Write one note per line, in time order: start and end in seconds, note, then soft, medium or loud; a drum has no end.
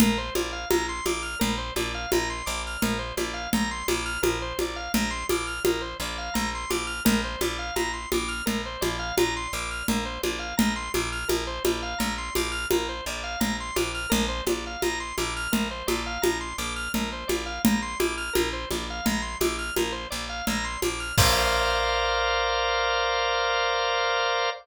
0.00 0.30 A#1 medium
0.00 0.18 A#4 medium
0.00 low conga loud
0.18 0.34 C5 medium
0.35 0.65 A#1 medium
0.35 0.52 D5 medium
0.35 high conga medium
0.52 0.68 F5 medium
0.70 1.01 A#1 medium
0.70 0.86 A#5 medium
0.70 high conga loud
0.89 1.05 C6 medium
1.05 1.35 A#1 medium
1.05 1.22 D6 medium
1.05 high conga medium
1.22 1.38 F6 medium
1.39 1.71 A#1 medium
1.39 1.55 A#4 medium
1.39 low conga loud
1.58 1.74 C5 medium
1.76 2.06 A#1 medium
1.76 1.92 D5 medium
1.76 high conga medium
1.95 2.10 F5 medium
2.12 2.42 A#1 medium
2.12 2.28 A#5 medium
2.12 high conga loud
2.30 2.46 C6 medium
2.46 2.77 A#1 medium
2.46 2.62 D6 medium
2.67 2.83 F6 medium
2.82 3.12 A#1 medium
2.82 2.98 A#4 medium
2.82 low conga loud
2.99 3.15 C5 medium
3.17 3.47 A#1 medium
3.17 3.34 D5 medium
3.17 high conga medium
3.34 3.50 F5 medium
3.53 3.83 A#1 medium
3.53 3.70 A#5 medium
3.53 low conga loud
3.71 3.87 C6 medium
3.88 4.18 A#1 medium
3.88 4.05 D6 medium
3.88 high conga medium
4.06 4.21 F6 medium
4.22 4.53 A#1 medium
4.22 4.38 A#4 medium
4.22 high conga loud
4.42 4.58 C5 medium
4.59 4.89 A#1 medium
4.59 4.77 D5 medium
4.59 high conga medium
4.76 4.92 F5 medium
4.94 5.24 A#1 medium
4.94 5.10 A#5 medium
4.94 low conga loud
5.11 5.26 C6 medium
5.29 5.60 A#1 medium
5.29 5.46 D6 medium
5.29 high conga loud
5.47 5.63 F6 medium
5.65 5.95 A#1 medium
5.65 5.82 A#4 medium
5.65 high conga loud
5.81 5.97 C5 medium
6.00 6.30 A#1 medium
6.00 6.17 D5 medium
6.18 6.34 F5 medium
6.34 6.65 A#1 medium
6.34 6.50 A#5 medium
6.34 low conga medium
6.55 6.71 C6 medium
6.70 7.01 A#1 medium
6.70 6.86 D6 medium
6.70 high conga medium
6.87 7.03 F6 medium
7.05 7.36 A#1 medium
7.05 7.21 A#4 medium
7.05 low conga loud
7.24 7.40 C5 medium
7.41 7.71 A#1 medium
7.41 7.58 D5 medium
7.41 high conga medium
7.59 7.75 F5 medium
7.76 8.06 A#1 medium
7.76 7.92 A#5 medium
7.76 high conga medium
7.93 8.09 C6 medium
8.12 8.42 A#1 medium
8.12 8.30 D6 medium
8.12 high conga medium
8.28 8.44 F6 medium
8.46 8.77 A#1 medium
8.46 8.62 A#4 medium
8.46 low conga loud
8.66 8.81 C5 medium
8.81 9.12 A#1 medium
8.81 8.97 D5 medium
8.81 high conga medium
8.99 9.15 F5 medium
9.17 9.47 A#1 medium
9.17 9.34 A#5 medium
9.17 high conga loud
9.36 9.52 C6 medium
9.53 9.83 A#1 medium
9.53 9.70 D6 medium
9.71 9.87 F6 medium
9.88 10.19 A#1 medium
9.88 10.04 A#4 medium
9.88 low conga loud
10.05 10.21 C5 medium
10.23 10.53 A#1 medium
10.23 10.39 D5 medium
10.23 high conga medium
10.39 10.55 F5 medium
10.57 10.89 A#1 medium
10.57 10.73 A#5 medium
10.57 low conga loud
10.76 10.92 C6 medium
10.94 11.24 A#1 medium
10.94 11.10 D6 medium
10.94 high conga medium
11.12 11.28 F6 medium
11.28 11.59 A#1 medium
11.28 11.44 A#4 medium
11.28 high conga loud
11.47 11.63 C5 medium
11.65 11.95 A#1 medium
11.65 11.81 D5 medium
11.65 high conga loud
11.83 11.99 F5 medium
11.99 12.30 A#1 medium
11.99 12.14 A#5 medium
11.99 low conga medium
12.18 12.34 C6 medium
12.35 12.66 A#1 medium
12.35 12.51 D6 medium
12.35 high conga medium
12.52 12.67 F6 medium
12.71 13.01 A#1 medium
12.71 12.87 A#4 medium
12.71 high conga loud
12.89 13.05 C5 medium
13.06 13.36 A#1 medium
13.06 13.23 D5 medium
13.24 13.39 F5 medium
13.40 13.71 A#1 medium
13.40 13.56 A#5 medium
13.40 low conga loud
13.60 13.76 C6 medium
13.76 14.06 A#1 medium
13.76 13.92 D6 medium
13.76 high conga medium
13.95 14.10 F6 medium
14.10 14.42 A#1 medium
14.10 14.26 A#4 medium
14.10 low conga loud
14.29 14.44 C5 medium
14.46 14.76 A#1 medium
14.46 14.65 D5 medium
14.46 high conga loud
14.67 14.82 F5 medium
14.82 15.13 A#1 medium
14.82 14.99 A#5 medium
14.82 high conga medium
15.00 15.16 C6 medium
15.18 15.48 A#1 medium
15.18 15.34 D6 medium
15.18 high conga medium
15.36 15.52 F6 medium
15.52 15.83 A#1 medium
15.52 15.68 A#4 medium
15.52 low conga loud
15.71 15.87 C5 medium
15.87 16.18 A#1 medium
15.87 16.03 D5 medium
15.87 high conga medium
16.06 16.22 F5 medium
16.22 16.53 A#1 medium
16.22 16.38 A#5 medium
16.22 high conga loud
16.41 16.56 C6 medium
16.58 16.88 A#1 medium
16.58 16.74 D6 medium
16.76 16.92 F6 medium
16.94 17.24 A#1 medium
16.94 17.10 A#4 medium
16.94 low conga medium
17.12 17.28 C5 medium
17.28 17.59 A#1 medium
17.28 17.44 D5 medium
17.28 high conga medium
17.46 17.62 F5 medium
17.65 17.95 A#1 medium
17.65 17.81 A#5 medium
17.65 low conga loud
17.82 17.98 C6 medium
17.99 18.30 A#1 medium
17.99 18.15 D6 medium
17.99 high conga loud
18.17 18.33 F6 medium
18.33 18.65 A#1 medium
18.33 18.49 A#4 medium
18.33 high conga loud
18.53 18.69 C5 medium
18.71 19.01 A#1 medium
18.71 18.87 D5 medium
18.71 high conga medium
18.90 19.06 F5 medium
19.05 19.36 A#1 medium
19.05 19.21 A#5 medium
19.05 low conga loud
19.22 19.38 C6 medium
19.40 19.71 A#1 medium
19.40 19.56 D6 medium
19.40 high conga loud
19.59 19.74 F6 medium
19.76 20.07 A#1 medium
19.76 19.93 A#4 medium
19.76 high conga medium
19.92 20.08 C5 medium
20.10 20.42 A#1 medium
20.10 20.26 D5 medium
20.29 20.45 F5 medium
20.47 20.77 A#1 medium
20.47 20.65 A#5 medium
20.47 low conga medium
20.64 20.80 C6 medium
20.82 21.12 A#1 medium
20.82 21.00 D6 medium
20.82 high conga medium
21.00 21.16 F6 medium
21.18 24.50 A#1 loud
21.18 24.50 A#4 medium
21.18 24.50 C5 loud
21.18 24.50 D5 loud
21.18 24.50 F5 medium
21.18 kick loud
21.18 crash loud